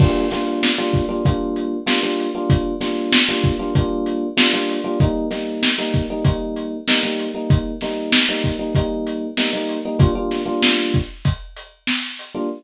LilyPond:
<<
  \new Staff \with { instrumentName = "Electric Piano 1" } { \time 4/4 \key g \minor \tempo 4 = 96 <g bes d' f'>8 <g bes d' f'>8. <g bes d' f'>8 <g bes d' f'>16 <g bes d' f'>4 <g bes d' f'>16 <g bes d' f'>8 <g bes d' f'>16~ | <g bes d' f'>8 <g bes d' f'>8. <g bes d' f'>8 <g bes d' f'>16 <g bes d' f'>4 <g bes d' f'>16 <g bes d' f'>8 <g bes d' f'>16 | <g bes ees'>8 <g bes ees'>8. <g bes ees'>8 <g bes ees'>16 <g bes ees'>4 <g bes ees'>16 <g bes ees'>8 <g bes ees'>16~ | <g bes ees'>8 <g bes ees'>8. <g bes ees'>8 <g bes ees'>16 <g bes ees'>4 <g bes ees'>16 <g bes ees'>8 <g bes ees'>16 |
<g bes d' f'>16 <g bes d' f'>8 <g bes d' f'>2. <g bes d' f'>16 | }
  \new DrumStaff \with { instrumentName = "Drums" } \drummode { \time 4/4 <cymc bd>8 <hh sn>8 sn8 <hh bd>8 <hh bd>8 hh8 sn8 hh8 | <hh bd>8 <hh sn>8 sn8 <hh bd>8 <hh bd>8 hh8 sn8 hho8 | <hh bd>8 <hh sn>8 sn8 <hh bd>8 <hh bd>8 hh8 sn8 hh8 | <hh bd>8 <hh sn>8 sn8 <hh bd>8 <hh bd>8 hh8 sn8 hh8 |
<hh bd>8 <hh sn>8 sn8 <hh bd>8 <hh bd>8 hh8 sn8 hh8 | }
>>